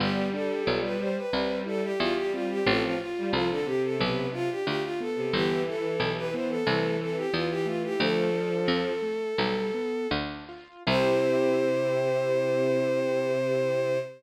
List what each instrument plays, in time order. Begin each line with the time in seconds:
0.00 harpsichord G1, violin G3 G4, acoustic grand piano B3
0.33 acoustic grand piano D4, violin A4
0.67 harpsichord B1, acoustic grand piano F4
0.84 violin B4
1.00 acoustic grand piano G4, violin C5
1.17 violin B4
1.33 harpsichord C2, violin G3, acoustic grand piano C4
1.66 acoustic grand piano E4, violin A4
1.83 violin G4
1.99 harpsichord E2, violin G3 F4, acoustic grand piano G4
2.16 violin G4
2.33 acoustic grand piano C4, violin F4
2.50 violin G4
2.66 harpsichord A1, violin F3 A4, acoustic grand piano C4
2.84 violin F4
3.00 violin F4, acoustic grand piano F4
3.18 violin G3
3.33 harpsichord C2, violin F3 F4, acoustic grand piano A4
3.50 violin D3 A4
3.66 violin C3 G4, acoustic grand piano C4
3.84 violin A4
3.99 harpsichord B1, acoustic grand piano B3, violin B4
4.33 acoustic grand piano D4, violin F4
4.50 violin G4
4.66 harpsichord D2, acoustic grand piano F4, violin G4
4.83 violin F4
5.00 acoustic grand piano B3, violin A4
5.16 violin C3
5.33 harpsichord G1, violin E3 G4, acoustic grand piano B3
5.66 acoustic grand piano E4, violin A4
5.99 harpsichord B1, acoustic grand piano G4
6.17 violin B4
6.33 acoustic grand piano B3, violin C5
6.50 violin A4
6.66 harpsichord C2, violin E3, acoustic grand piano A3
7.00 acoustic grand piano C4, violin A4
7.17 violin G4
7.32 harpsichord E2, violin E3 F4, acoustic grand piano E4
7.50 violin G4
7.66 acoustic grand piano A3, violin F4
7.84 violin G4
7.98 harpsichord D2, violin F3 A4, acoustic grand piano A3
8.33 acoustic grand piano D4
8.68 harpsichord F2, acoustic grand piano F4
9.02 acoustic grand piano A3
9.38 harpsichord B1, acoustic grand piano G3
9.74 acoustic grand piano B3
10.11 harpsichord D2, acoustic grand piano D4
10.49 acoustic grand piano F4
10.87 harpsichord C2, violin C3 C5, acoustic grand piano C4 E4 G4